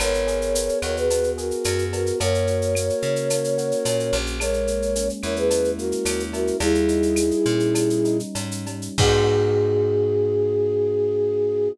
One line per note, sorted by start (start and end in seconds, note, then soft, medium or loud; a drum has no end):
0.00 0.70 G#1 medium
0.00 0.54 B3 medium
0.00 0.79 A#4 medium
0.00 0.79 C#5 medium
0.00 cowbell loud
0.00 claves loud
0.00 shaker loud
0.14 shaker medium
0.27 1.37 G#4 medium
0.27 shaker medium
0.42 shaker medium
0.55 1.10 B3 medium
0.55 shaker loud
0.69 shaker medium
0.82 1.52 D#2 medium
0.82 1.64 F#4 medium
0.82 0.96 A#4 medium
0.82 0.96 C#5 medium
0.82 claves medium
0.82 shaker medium
0.96 1.30 G#4 medium
0.96 1.30 B4 medium
0.96 shaker medium
1.10 1.92 B3 medium
1.10 cowbell medium
1.10 shaker loud
1.24 shaker medium
1.38 1.85 F#4 medium
1.38 2.16 G#4 medium
1.38 1.85 A#4 medium
1.38 shaker medium
1.51 shaker medium
1.64 2.12 F#2 medium
1.64 2.17 F#4 medium
1.64 cowbell medium
1.64 claves medium
1.64 shaker loud
1.79 shaker medium
1.93 2.19 B3 medium
1.93 2.19 F#4 medium
1.93 2.19 A#4 medium
1.93 cowbell medium
1.93 shaker medium
2.06 shaker medium
2.20 2.91 F#2 medium
2.20 2.75 A#3 medium
2.20 4.15 A#4 medium
2.20 4.15 C#5 medium
2.20 cowbell medium
2.20 shaker medium
2.34 shaker medium
2.47 3.57 F#4 medium
2.47 shaker medium
2.62 shaker medium
2.75 3.31 A#3 medium
2.75 claves medium
2.75 shaker loud
2.90 shaker medium
3.02 3.73 C#3 medium
3.02 3.85 C#4 medium
3.02 shaker medium
3.16 shaker medium
3.30 4.13 A#3 medium
3.30 cowbell medium
3.30 claves medium
3.30 shaker loud
3.44 shaker medium
3.58 4.36 F#4 medium
3.58 shaker medium
3.72 shaker medium
3.85 4.11 A#2 medium
3.85 4.38 C#4 medium
3.85 cowbell medium
3.85 shaker loud
4.00 shaker medium
4.13 5.10 A#1 medium
4.13 4.39 A#3 medium
4.13 cowbell medium
4.13 shaker medium
4.26 shaker medium
4.40 5.50 G#3 medium
4.40 5.08 A#4 medium
4.40 5.08 C#5 medium
4.40 cowbell medium
4.40 claves loud
4.40 shaker loud
4.53 shaker medium
4.67 5.77 A#3 medium
4.67 shaker medium
4.82 shaker medium
4.96 6.05 C#4 medium
4.96 shaker loud
5.09 shaker medium
5.23 5.93 E2 medium
5.23 6.32 E4 medium
5.23 5.36 A#4 medium
5.23 5.36 C#5 medium
5.23 claves medium
5.23 shaker medium
5.36 5.71 G#4 medium
5.36 5.71 B4 medium
5.36 shaker medium
5.50 6.55 G#3 medium
5.50 cowbell medium
5.50 shaker loud
5.64 shaker medium
5.78 6.56 A#3 medium
5.78 6.23 F#4 medium
5.78 6.23 A#4 medium
5.78 shaker medium
5.92 shaker medium
6.05 6.52 D#2 medium
6.05 6.58 C#4 medium
6.05 cowbell medium
6.05 claves medium
6.05 shaker loud
6.20 shaker medium
6.33 6.59 E4 medium
6.33 6.57 F#4 medium
6.33 6.57 A#4 medium
6.33 cowbell medium
6.33 shaker medium
6.47 shaker medium
6.60 7.32 D#2 medium
6.60 7.16 G3 loud
6.60 8.18 E4 medium
6.60 8.18 G#4 medium
6.60 cowbell loud
6.60 shaker medium
6.75 shaker medium
6.88 8.04 D#4 medium
6.88 shaker medium
7.03 shaker medium
7.16 7.74 G3 medium
7.16 claves medium
7.16 shaker loud
7.31 shaker medium
7.45 8.22 A#2 medium
7.45 8.35 C#4 medium
7.45 shaker medium
7.60 shaker medium
7.75 8.66 G3 medium
7.75 cowbell medium
7.75 claves medium
7.75 shaker loud
7.90 shaker medium
8.05 8.94 D#4 medium
8.05 shaker medium
8.20 shaker medium
8.35 8.89 G#2 medium
8.35 8.95 C#4 medium
8.35 cowbell medium
8.35 shaker medium
8.51 shaker medium
8.66 8.97 G3 medium
8.66 cowbell medium
8.66 shaker medium
8.82 shaker medium
8.98 11.68 G#2 loud
8.98 11.69 B3 medium
8.98 11.69 D#4 loud
8.98 11.69 F#4 loud
8.98 11.69 G#4 loud
8.98 kick loud
8.98 crash loud